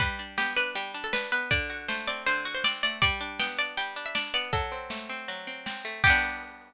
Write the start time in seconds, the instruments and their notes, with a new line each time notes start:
0.00 acoustic guitar (steel) G3, pizzicato strings B4, kick, closed hi-hat
0.19 acoustic guitar (steel) D4
0.38 acoustic guitar (steel) B3, pizzicato strings G4, snare
0.56 acoustic guitar (steel) D4, pizzicato strings B4
0.75 acoustic guitar (steel) G3, pizzicato strings G4, closed hi-hat
0.94 acoustic guitar (steel) D4
1.04 pizzicato strings A4
1.13 acoustic guitar (steel) D4, pizzicato strings B4, snare
1.32 acoustic guitar (steel) B3, pizzicato strings B4
1.51 acoustic guitar (steel) D3, pizzicato strings D5, kick, closed hi-hat
1.70 acoustic guitar (steel) F#4
1.88 acoustic guitar (steel) A3, pizzicato strings C5, snare
2.07 acoustic guitar (steel) C4, pizzicato strings D5
2.26 acoustic guitar (steel) D3, pizzicato strings C5, closed hi-hat
2.45 acoustic guitar (steel) F#4
2.55 pizzicato strings C5
2.64 acoustic guitar (steel) C4, pizzicato strings D5, snare
2.83 acoustic guitar (steel) A3, pizzicato strings D5
3.02 acoustic guitar (steel) G3, pizzicato strings D5, kick, closed hi-hat
3.21 acoustic guitar (steel) D4
3.39 acoustic guitar (steel) B3, pizzicato strings G5, snare
3.58 acoustic guitar (steel) D4, pizzicato strings D5
3.77 acoustic guitar (steel) G3, pizzicato strings G5, closed hi-hat
3.96 acoustic guitar (steel) D4
4.06 pizzicato strings E5
4.15 acoustic guitar (steel) D4, pizzicato strings D5, snare
4.34 acoustic guitar (steel) B3, pizzicato strings D5
4.53 acoustic guitar (steel) F#3, pizzicato strings A4, kick, closed hi-hat
4.72 acoustic guitar (steel) C4
4.90 acoustic guitar (steel) A3, snare
5.10 acoustic guitar (steel) C4
5.28 acoustic guitar (steel) F#3, closed hi-hat
5.47 acoustic guitar (steel) C4
5.66 acoustic guitar (steel) C4, snare
5.85 acoustic guitar (steel) A3
6.04 acoustic guitar (steel) G3 B3, pizzicato strings G4, kick, crash
6.10 acoustic guitar (steel) D4